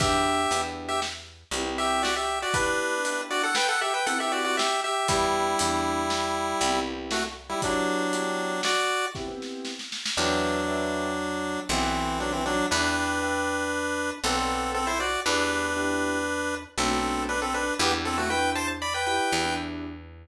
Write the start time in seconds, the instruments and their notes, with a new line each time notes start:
0.00 electric bass (finger) E2, acoustic grand piano B3 D4 E4 G4, lead 1 (square) G4 E5, kick, closed hi-hat
0.51 electric bass (finger) E2, acoustic grand piano B3 D4 E4 G4, closed hi-hat
0.88 lead 1 (square) G4 E5
1.02 snare
1.51 electric bass (finger) C2, acoustic grand piano B3 C4 E4 G4, closed hi-hat
1.65 acoustic grand piano B3 C4 E4 G4
1.78 lead 1 (square) G4 E5
2.03 lead 1 (square) F#4 D5, snare
2.16 lead 1 (square) G4 E5
2.42 lead 1 (square) F#4 D5
2.54 acoustic grand piano B3 D4 E4 G4, lead 1 (square) D4 B4, kick, closed hi-hat
3.05 acoustic grand piano B3 D4 E4 G4, closed hi-hat
3.31 lead 1 (square) F#4 D5
3.43 lead 1 (square) A4 F#5
3.55 lead 1 (square) B4 G5, snare
3.69 lead 1 (square) A4 F#5
3.81 lead 1 (square) G4 E5
3.94 lead 1 (square) B4 G5
4.06 acoustic grand piano B3 C4 E4 G4, lead 1 (square) A4 F#5, closed hi-hat
4.20 acoustic grand piano B3 C4 E4 G4, lead 1 (square) G4 E5
4.32 lead 1 (square) F#4 D5
4.44 lead 1 (square) F#4 D5
4.57 lead 1 (square) G4 E5, snare
4.84 lead 1 (square) G4 E5
5.08 electric bass (finger) E2, lead 1 (square) G3 E4, acoustic grand piano B3 D4 E4 G4, kick, closed hi-hat
5.59 electric bass (finger) E2, acoustic grand piano B3 D4 E4 G4, closed hi-hat
6.10 snare
6.61 electric bass (finger) C2, acoustic grand piano B3 C4 E4 G4, closed hi-hat
6.74 acoustic grand piano B3 C4 E4 G4
7.11 lead 1 (square) A3 F#4, snare
7.49 lead 1 (square) G3 E4
7.62 lead 1 (square) F#3 D4, acoustic grand piano B3 D4 E4 G4, kick, closed hi-hat
8.13 acoustic grand piano B3 D4 E4 G4, closed hi-hat
8.63 lead 1 (square) F#4 D5, snare
9.15 acoustic grand piano B3 C4 E4 G4, kick, snare
9.28 acoustic grand piano B3 C4 E4 G4
9.42 snare
9.65 snare
9.79 snare
9.92 snare
10.06 snare
10.17 electric bass (finger) E2, lead 1 (square) F#3 D4, acoustic grand piano B4 D5 E5 G5
10.68 acoustic grand piano B4 D5 E5 G5
11.69 electric bass (finger) B1, lead 1 (square) E3 C4, acoustic grand piano A4 B4 D5 F#5
11.83 acoustic grand piano A4 B4 D5 F#5
12.20 lead 1 (square) F#3 D4
12.32 lead 1 (square) E3 C4
12.46 lead 1 (square) F#3 D4
12.71 electric bass (finger) E2, lead 1 (square) D4 B4, acoustic grand piano B4 D5 E5 G5
13.22 acoustic grand piano B4 D5 E5 G5
14.24 electric bass (finger) B1, lead 1 (square) C4 A4, acoustic grand piano A4 B4 D5 F#5
14.37 acoustic grand piano A4 B4 D5 F#5
14.74 lead 1 (square) C4 A4
14.87 lead 1 (square) E4 C5
15.00 lead 1 (square) F#4 D5
15.26 electric bass (finger) E2, acoustic grand piano B3 D4 E4 G4, lead 1 (square) D4 B4
15.76 acoustic grand piano B3 D4 E4 G4
16.78 electric bass (finger) B1, acoustic grand piano A3 B3 D4 F#4, lead 1 (square) C4 A4
16.91 acoustic grand piano A3 B3 D4 F#4
17.29 lead 1 (square) D4 B4
17.42 lead 1 (square) C4 A4
17.54 lead 1 (square) D4 B4
17.79 electric bass (finger) E2, acoustic grand piano B3 D4 E4 G4, lead 1 (square) B3 G4
18.05 lead 1 (square) C4 A4
18.18 lead 1 (square) A3 F#4
18.30 acoustic grand piano B3 D4 E4 G4, lead 1 (square) B4 G5
18.55 lead 1 (square) C5 A5
18.82 lead 1 (square) D5 B5
18.94 lead 1 (square) B4 G5
19.06 acoustic grand piano B3 D4 E4 G4, lead 1 (square) B4 G5
19.32 electric bass (finger) E2
19.45 acoustic grand piano B3 D4 E4 G4